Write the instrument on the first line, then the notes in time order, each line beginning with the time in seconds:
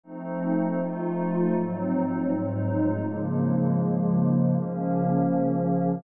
pad 5 (bowed)
0.03 F3 A3 C4 D#4
0.79 F3 A3 D#4 F4
1.54 G#2 F#3 C4 D#4
2.29 G#2 F#3 G#3 D#4
3.04 C#3 F3 G#3 A#3
4.54 C#3 F3 A#3 C#4